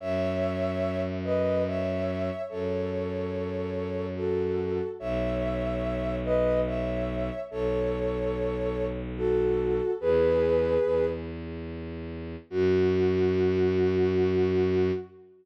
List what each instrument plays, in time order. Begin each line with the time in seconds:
0.00 violin F#2, ocarina C#5 E5
1.24 ocarina B4 D#5
1.67 ocarina C#5 E5
2.49 violin F#2, ocarina A4 C#5
4.16 ocarina F#4 A4
4.99 violin B1, ocarina C#5 E5
6.24 ocarina B4 D#5
6.66 ocarina C#5 E5
7.51 violin B1, ocarina A4 C#5
9.17 ocarina F#4 A4
10.01 violin E2, ocarina G#4 B4
10.83 violin E2
12.50 violin F#2, ocarina F#4